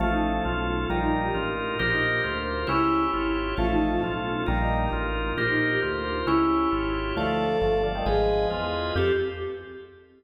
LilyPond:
<<
  \new Staff \with { instrumentName = "Choir Aahs" } { \time 2/2 \key g \minor \tempo 2 = 134 eis'8 ees'4 eis'8 r2 | f'8 ees'4 g'8 r2 | f'8 ees'4 g'8 r2 | e'2 r2 |
eis'8 ees'4 eis'8 r2 | f'8 ees'4 g'8 r2 | f'8 ees'4 g'8 r2 | e'2 r2 |
a'2. r4 | aes'2 r2 | g'2 r2 | }
  \new Staff \with { instrumentName = "Drawbar Organ" } { \time 2/2 \key g \minor <eis a>2 eis'2 | <g bes>2 f'2 | <g' bes'>2 f'2 | <cis' e'>2 f'2 |
<eis a>2 eis'2 | <g bes>2 f'2 | <g' bes'>2 f'2 | <cis' e'>2 f'2 |
<f a>2 <f a>4 <d f>8 <ees g>8 | <f aes>2 f'2 | g'2 r2 | }
  \new Staff \with { instrumentName = "Drawbar Organ" } { \time 2/2 \key g \minor <cis' eis' a'>1 | <ees' f' bes'>1 | <f' bes' c''>1 | <e' g' cis''>1 |
<cis' eis' a'>1 | <ees' f' bes'>1 | <f' bes' c''>1 | <e' g' cis''>1 |
<f' a' d''>1 | <aes' ces'' ees''>1 | <c' f' a'>2 r2 | }
  \new Staff \with { instrumentName = "Synth Bass 1" } { \clef bass \time 2/2 \key g \minor a,,2 b,,2 | bes,,2 a,,2 | bes,,2 d,2 | cis,2 aes,,2 |
a,,2 b,,2 | bes,,2 a,,2 | bes,,2 d,2 | cis,2 aes,,2 |
d,2 g,,2 | aes,,2 e,2 | f,2 r2 | }
>>